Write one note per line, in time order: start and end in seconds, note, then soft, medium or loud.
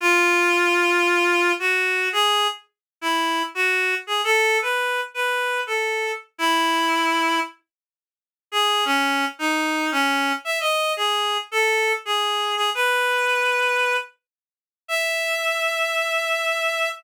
0.01 1.52 F4 loud
1.59 2.09 F#4 medium
2.13 2.47 G#4 loud
3.01 3.43 E4 medium
3.55 3.95 F#4 medium
4.07 4.21 G#4 medium
4.24 4.58 A4 loud
4.62 5.01 B4 medium
5.14 5.61 B4 medium
5.67 6.12 A4 medium
6.38 7.40 E4 loud
8.52 8.84 G#4 loud
8.85 9.25 C#4 loud
9.39 9.90 D#4 medium
9.92 10.32 C#4 loud
10.45 10.59 E5 medium
10.60 10.93 D#5 medium
10.97 11.38 G#4 medium
11.51 11.92 A4 loud
12.05 12.55 G#4 medium
12.56 12.70 G#4 medium
12.75 13.96 B4 loud
14.88 16.89 E5 loud